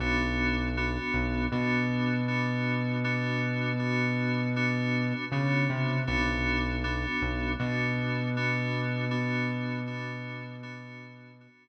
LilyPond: <<
  \new Staff \with { instrumentName = "Electric Piano 2" } { \time 4/4 \key b \minor \tempo 4 = 79 <b d' fis'>4 <b d' fis'>4 <b d' fis'>4 <b d' fis'>4 | <b d' fis'>4 <b d' fis'>4 <b d' fis'>4 <b d' fis'>4 | <b d' fis'>4 <b d' fis'>4 <b d' fis'>4 <b d' fis'>4 | <b d' fis'>4 <b d' fis'>4 <b d' fis'>4 <b d' fis'>4 | }
  \new Staff \with { instrumentName = "Synth Bass 1" } { \clef bass \time 4/4 \key b \minor b,,4. b,,8 b,2~ | b,2. cis8 c8 | b,,4. b,,8 b,2~ | b,1 | }
>>